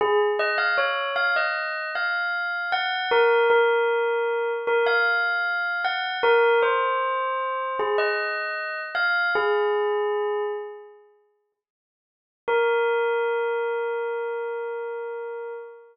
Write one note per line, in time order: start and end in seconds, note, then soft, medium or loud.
0.01 0.19 G#4 loud
0.39 0.58 D#5 loud
0.58 0.76 F5 loud
0.78 1.09 C#5 medium
1.16 1.34 F5 loud
1.36 1.90 D#5 medium
1.95 2.71 F5 medium
2.72 3.10 F#5 loud
3.11 3.47 A#4 loud
3.50 4.51 A#4 loud
4.67 4.86 A#4 loud
4.87 5.81 F5 loud
5.85 6.18 F#5 loud
6.23 6.59 A#4 loud
6.63 7.75 C5 loud
7.79 7.98 G#4 loud
7.98 8.81 D#5 loud
8.95 9.30 F5 loud
9.35 10.43 G#4 loud
12.48 15.53 A#4 loud